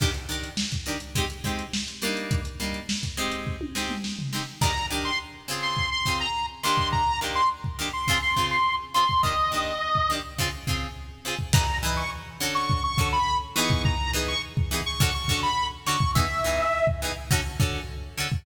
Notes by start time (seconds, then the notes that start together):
0.00 D#3 D4 G4 A#4, kick, crash
0.14 closed hi-hat
0.29 D#3 D4 G4 A#4, closed hi-hat
0.44 closed hi-hat
0.57 snare
0.72 kick, closed hi-hat
0.86 D#3 D4 G4 A#4, closed hi-hat
1.00 closed hi-hat
1.15 G#3 C4 D#4 G4, kick, closed hi-hat
1.30 closed hi-hat
1.44 G#3 C4 D#4 G4, kick, snare, closed hi-hat
1.59 closed hi-hat
1.73 snare
1.88 snare, closed hi-hat
2.02 G3 A#3 D4 D#4, closed hi-hat
2.17 closed hi-hat
2.31 kick, closed hi-hat
2.45 closed hi-hat
2.60 G3 A#3 D4 D#4, closed hi-hat
2.74 closed hi-hat
2.89 snare
3.03 kick, closed hi-hat
3.17 G#3 C4 D#4 G4, closed hi-hat
3.31 closed hi-hat
3.47 kick
3.61 high tom
3.75 G#3 C4 D#4 G4, snare
3.89 mid tom
4.04 snare
4.19 floor tom
4.33 G#3 C4 D#4 G4, snare
4.61 D#3 D4 G4 A#4 A#5, kick, crash
4.90 D#3 D4 G4 A#4
5.05 C6
5.48 C#3 C4 F4 G#4
5.62 C6
5.77 kick
5.91 C6
6.06 C#3 C4 F4 G#4, kick
6.20 A#5
6.63 D#3 A#3 D4 G4 C6
6.78 kick
6.92 A#5, kick
7.21 D#3 A#3 D4 G4
7.35 C6
7.64 kick
7.79 D#3 A#3 D4 G4
7.93 C6
8.08 C#3 C4 F4 G#4, kick
8.22 C6
8.36 C#3 C4 F4 G#4, kick
8.51 C6
8.94 C#3 C4 F4 G#4 C6
9.09 kick
9.23 D#3 A#3 D4 G4 D#5, kick
9.52 D#3 A#3 D4 G4
9.95 kick
10.10 D#3 A#3 D4 G4
10.38 C#3 C4 F4 G#4, kick
10.67 C#3 C4 F4 G#4, kick
11.25 C#3 C4 F4 G#4
11.39 kick
11.53 E3 D#4 G#4 B4 A#5, kick, crash
11.83 E3 D#4 G#4 B4
11.97 C#6
12.40 D3 C#4 F#4 A4
12.55 C#6
12.70 kick
12.84 C#6
12.98 D3 C#4 F#4 A4, kick
13.13 B5
13.56 E3 B3 D#4 G#4 C#6
13.70 kick
13.85 A#5, kick
14.13 E3 B3 D#4 G#4
14.28 C#6
14.57 kick
14.71 E3 B3 D#4 G#4
14.86 C#6
15.00 D3 C#4 F#4 A4, kick
15.14 C#6
15.28 D3 C#4 F#4 A4, kick
15.43 B5
15.86 D3 C#4 F#4 A4 C#6
16.00 kick
16.15 E3 B3 D#4 G#4 E5, kick
16.44 E3 B3 D#4 G#4
16.87 kick
17.02 E3 B3 D#4 G#4
17.31 D3 C#4 F#4 A4, kick
17.60 D3 C#4 F#4 A4, kick
18.18 D3 C#4 F#4 A4
18.32 kick